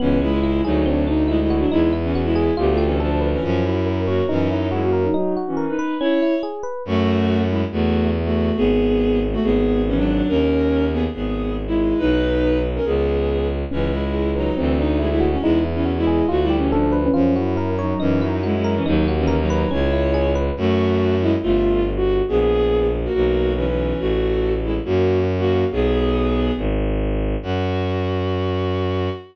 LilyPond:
<<
  \new Staff \with { instrumentName = "Violin" } { \time 4/4 \key cis \dorian \tempo 4 = 140 <e cis'>8 <gis e'>4 <fis dis'>8 <fis d'>8 dis'8 <gis e'>16 <gis e'>8 <fis d'>16 | <gis e'>8 r16 <e cis'>8 <gis e'>8. \tuplet 3/2 { <b g'>8 <a f'>8 <e cis'>8 } <f d'>8. <e cis'>16 | <eis cis'>8 e'4 <ais fis'>8 <e cis'>8 <fis dis'>8 <gis e'>16 <ais fis'>8 <fis dis'>16 | <fis dis'>8 r16 <e cis'>8 <dis' b'>8. <e' cis''>4 r4 |
\key fis \dorian <a fis'>4. <gis e'>16 r16 <a fis'>4 r16 <a fis'>8. | <b gis'>4. r16 <a fis'>16 <b gis'>4 <e cis'>16 <fis d'>8. | <cis' ais'>4. <b gis'>16 r16 <b gis'>4 r16 <gis e'>8. | <dis' b'>4. r16 <cis' ais'>16 <b gis'>4. r8 |
\key cis \dorian <e cis'>8 <gis e'>4 <fis dis'>8 <e c'>8 dis'8 <gis e'>16 <gis e'>8 cis'16 | <gis e'>8 r16 <e cis'>8 <gis e'>8. \tuplet 3/2 { fis'8 <g e'>8 <e cis'>8 } <f d'>8. <e cis'>16 | <eis cis'>8 e'4 <fis dis'>8 <e cis'>8 <fis dis'>8 <gis e'>16 <gis e'>8 <e cis'>16 | <fis dis'>8 r16 <e cis'>8 <fis dis'>8. <e' cis''>4. r8 |
\key fis \dorian <a fis'>4. <gis e'>16 r16 <a f'>4 r16 fis'8. | <b gis'>4. r16 <ais fis'>16 <ais fis'>4 <e cis'>16 <e cis'>8. | <a fis'>4. <gis e'>16 r16 <ais fis'>4 r16 <ais fis'>8. | <b gis'>2 r2 |
fis'1 | }
  \new Staff \with { instrumentName = "Electric Piano 1" } { \time 4/4 \key cis \dorian b8 cis'8 e'8 gis'8 c'8 d'8 e'8 fis'8 | dis'8 e'8 fis'8 gis'8 f'8 g'8 a'8 b'8 | eis'8 fis'8 ais'8 cis''8 dis'8 e'8 fis'8 ais'8 | dis'8 fis'8 ais'8 b'8 cis'8 e'8 gis'8 b'8 |
\key fis \dorian r1 | r1 | r1 | r1 |
\key cis \dorian cis'8 e'8 gis'8 b'8 c'8 d'8 e'8 fis'8 | dis'8 e'8 fis'8 gis'8 f'8 g'8 a'8 b'8 | eis'8 fis'8 ais'8 cis''8 dis'8 e'8 fis'8 ais'8 | dis'8 fis'8 ais'8 b'8 cis'8 e'8 gis'8 b'8 |
\key fis \dorian r1 | r1 | r1 | r1 |
r1 | }
  \new Staff \with { instrumentName = "Violin" } { \clef bass \time 4/4 \key cis \dorian cis,4. d,2~ d,8 | e,2 d,2 | fis,2 fis,2 | r1 |
\key fis \dorian fis,2 e,2 | gis,,2 gis,,2 | dis,2 gis,,2 | b,,2 cis,2 |
\key cis \dorian cis,2 d,2 | e,2 d,2 | fis,2 fis,2 | dis,2 cis,2 |
\key fis \dorian fis,2 g,,2 | ais,,2 b,,2 | a,,2 fis,2 | b,,2 gis,,2 |
fis,1 | }
>>